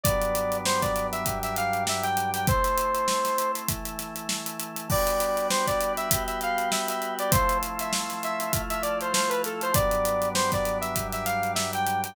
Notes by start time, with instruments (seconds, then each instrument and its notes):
0.04 drawbar organ G2 F#3 B3 D4, lead 2 (sawtooth) D5, kick, closed hi-hat
0.22 closed hi-hat
0.35 closed hi-hat
0.52 closed hi-hat
0.66 lead 2 (sawtooth) C5, snare
0.82 lead 2 (sawtooth) D5, kick, snare, closed hi-hat
0.96 snare, closed hi-hat
1.12 lead 2 (sawtooth) E5, closed hi-hat
1.26 drawbar organ G2 F#3 G3 D4, kick, closed hi-hat
1.43 lead 2 (sawtooth) E5, snare, closed hi-hat
1.56 lead 2 (sawtooth) F5, snare, closed hi-hat
1.73 closed hi-hat
1.87 lead 2 (sawtooth) E5, snare
2.03 lead 2 (sawtooth) G5, closed hi-hat
2.17 closed hi-hat
2.34 lead 2 (sawtooth) G5, closed hi-hat
2.47 drawbar organ A3 C4 E4, lead 2 (sawtooth) C5, kick, closed hi-hat
2.64 snare, closed hi-hat
2.78 closed hi-hat
2.95 closed hi-hat
3.08 snare
3.25 snare, closed hi-hat
3.38 closed hi-hat
3.55 closed hi-hat
3.68 drawbar organ E3 A3 E4, kick, closed hi-hat
3.85 closed hi-hat
3.99 snare, closed hi-hat
4.16 closed hi-hat
4.29 snare
4.46 closed hi-hat
4.60 closed hi-hat
4.77 closed hi-hat
4.90 drawbar organ G3 B3 D4 F#4, lead 2 (sawtooth) D5, kick, crash
5.07 closed hi-hat
5.20 closed hi-hat
5.37 closed hi-hat
5.50 lead 2 (sawtooth) C5, snare
5.67 lead 2 (sawtooth) D5, kick, snare, closed hi-hat
5.81 closed hi-hat
5.97 lead 2 (sawtooth) E5, closed hi-hat
6.11 drawbar organ G3 B3 F#4 G4, kick, closed hi-hat
6.27 lead 2 (sawtooth) E5, closed hi-hat
6.41 lead 2 (sawtooth) F5, closed hi-hat
6.58 closed hi-hat
6.72 lead 2 (sawtooth) E5, snare
6.89 lead 2 (sawtooth) E5, snare, closed hi-hat
7.02 closed hi-hat
7.19 lead 2 (sawtooth) D5, closed hi-hat
7.31 drawbar organ F3 A3 C4 E4, lead 2 (sawtooth) C5, kick, closed hi-hat
7.49 closed hi-hat
7.63 closed hi-hat
7.79 lead 2 (sawtooth) E5, closed hi-hat
7.93 snare
8.10 snare, closed hi-hat
8.23 lead 2 (sawtooth) E5, snare, closed hi-hat
8.40 closed hi-hat
8.52 drawbar organ F3 A3 E4 F4, kick, closed hi-hat
8.70 lead 2 (sawtooth) E5, closed hi-hat
8.82 lead 2 (sawtooth) D5, closed hi-hat
9.01 lead 2 (sawtooth) C5, closed hi-hat
9.14 lead 2 (sawtooth) C5, snare
9.29 lead 2 (sawtooth) B4, closed hi-hat
9.44 lead 2 (sawtooth) A4, snare, closed hi-hat
9.61 lead 2 (sawtooth) C5, closed hi-hat
9.74 drawbar organ G2 F#3 B3 D4, lead 2 (sawtooth) D5, kick, closed hi-hat
9.91 closed hi-hat
10.05 closed hi-hat
10.22 closed hi-hat
10.35 lead 2 (sawtooth) C5, snare
10.52 lead 2 (sawtooth) D5, kick, snare, closed hi-hat
10.65 snare, closed hi-hat
10.81 lead 2 (sawtooth) E5, closed hi-hat
10.96 drawbar organ G2 F#3 G3 D4, kick, closed hi-hat
11.13 lead 2 (sawtooth) E5, snare, closed hi-hat
11.26 lead 2 (sawtooth) F5, snare, closed hi-hat
11.43 closed hi-hat
11.55 lead 2 (sawtooth) E5, snare
11.73 lead 2 (sawtooth) G5, closed hi-hat
11.87 closed hi-hat
12.04 lead 2 (sawtooth) G5, closed hi-hat